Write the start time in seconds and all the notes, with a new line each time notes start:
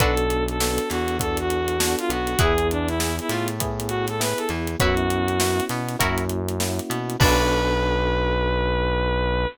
0.00 B1 B3 D4 F#4 A4 B4, kick, closed hi-hat
0.17 closed hi-hat
0.30 closed hi-hat
0.48 A4, closed hi-hat
0.60 B3 D4 F#4 A4, snare
0.78 closed hi-hat
0.90 E2 E3 F#4, snare, closed hi-hat
1.08 closed hi-hat
1.19 B3 D4 F#4 A4, kick, closed hi-hat
1.37 F#4, closed hi-hat
1.50 closed hi-hat
1.68 closed hi-hat
1.80 B3 D4 F#4 A4, snare
1.99 F4, closed hi-hat
2.09 B1 B3 F#4, closed hi-hat
2.27 closed hi-hat
2.39 E2 B3 E4 G#4 B4, kick, closed hi-hat
2.58 closed hi-hat
2.71 D4, closed hi-hat
2.88 E4, snare, closed hi-hat
3.00 B3 E4 G#4, snare
3.19 E4, closed hi-hat
3.29 A2 A3 F4, snare, closed hi-hat
3.48 closed hi-hat
3.60 B3 E4 G#4, kick, closed hi-hat
3.80 closed hi-hat
3.88 F#4, closed hi-hat
4.07 A4, snare, closed hi-hat
4.20 B3 E4 G#4 B4, snare
4.38 A4, closed hi-hat
4.49 E2 E3, snare, closed hi-hat
4.67 closed hi-hat
4.80 F#2 B3 C#4 E4 F#4 B4 C#5, kick, closed hi-hat
4.97 closed hi-hat
5.10 closed hi-hat
5.28 closed hi-hat
5.40 B3 C#4 E4 F#4, snare
5.60 closed hi-hat
5.69 B2 B3, snare, closed hi-hat
5.88 snare, closed hi-hat
5.99 F#2 A#3 C#4 E4 F#4 A#4 C#5, kick, closed hi-hat
6.18 closed hi-hat
6.29 closed hi-hat
6.49 closed hi-hat
6.60 A#3 C#4 E4 F#4, snare
6.79 closed hi-hat
6.90 B2 B3, closed hi-hat
7.10 closed hi-hat
7.20 B1 B3 D4 F#4 A4 B4, kick, crash